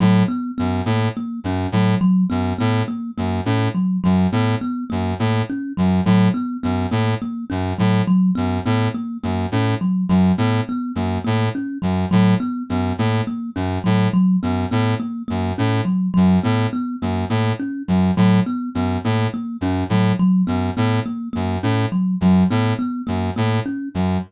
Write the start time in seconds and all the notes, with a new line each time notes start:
0.00 A2 F#3
0.28 B3
0.58 F#2 B3
0.86 A2 A#3
1.17 A#3
1.44 F#2 C#4
1.72 A2 F#3
2.01 F#3
2.30 F#2 B3
2.58 A2 B3
2.88 A#3
3.18 F#2 A#3
3.45 A2 C#4
3.75 F#3
4.04 F#2 F#3
4.32 A2 B3
4.61 B3
4.90 F#2 A#3
5.19 A2 A#3
5.50 C#4
5.77 F#2 F#3
6.05 A2 F#3
6.34 B3
6.63 F#2 B3
6.91 A2 A#3
7.22 A#3
7.50 F#2 C#4
7.78 A2 F#3
8.07 F#3
8.35 F#2 B3
8.65 A2 B3
8.94 A#3
9.23 F#2 A#3
9.52 A2 C#4
9.81 F#3
10.09 F#2 F#3
10.38 A2 B3
10.69 B3
10.95 F#2 A#3
11.24 A2 A#3
11.55 C#4
11.82 F#2 F#3
12.11 A2 F#3
12.40 B3
12.70 F#2 B3
12.98 A2 A#3
13.27 A#3
13.56 F#2 C#4
13.84 A2 F#3
14.13 F#3
14.43 F#2 B3
14.71 A2 B3
15.00 A#3
15.28 F#2 A#3
15.58 A2 C#4
15.85 F#3
16.14 F#2 F#3
16.44 A2 B3
16.73 B3
17.02 F#2 A#3
17.30 A2 A#3
17.59 C#4
17.88 F#2 F#3
18.17 A2 F#3
18.46 B3
18.75 F#2 B3
19.04 A2 A#3
19.34 A#3
19.61 F#2 C#4
19.89 A2 F#3
20.19 F#3
20.47 F#2 B3
20.77 A2 B3
21.06 A#3
21.33 F#2 A#3
21.63 A2 C#4
21.92 F#3
22.21 F#2 F#3
22.50 A2 B3
22.79 B3
23.07 F#2 A#3
23.36 A2 A#3
23.66 C#4
23.94 F#2 F#3